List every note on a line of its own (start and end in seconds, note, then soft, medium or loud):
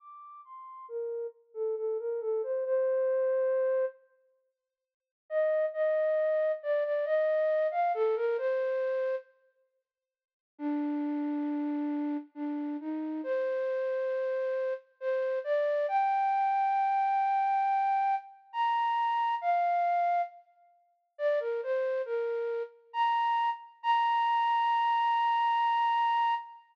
0.00 0.41 D6 medium
0.45 0.86 C6 medium
0.88 1.27 A#4 medium
1.54 1.75 A4 medium
1.76 1.97 A4 medium
1.99 2.20 A#4 medium
2.21 2.42 A4 medium
2.43 2.64 C5 medium
2.65 3.85 C5 medium
5.30 5.65 D#5 medium
5.73 6.52 D#5 medium
6.63 6.84 D5 medium
6.84 7.05 D5 medium
7.05 7.67 D#5 medium
7.71 7.92 F5 medium
7.94 8.15 A4 medium
8.16 8.37 A#4 medium
8.38 9.15 C5 medium
10.58 12.17 D4 medium
12.35 12.77 D4 medium
12.80 13.21 D#4 medium
13.23 14.74 C5 medium
15.00 15.39 C5 medium
15.44 15.86 D5 medium
15.88 18.15 G5 medium
18.53 19.35 A#5 medium
19.41 20.22 F5 medium
21.18 21.39 D5 medium
21.40 21.61 A#4 medium
21.63 22.02 C5 medium
22.05 22.63 A#4 medium
22.93 23.50 A#5 medium
23.83 26.34 A#5 loud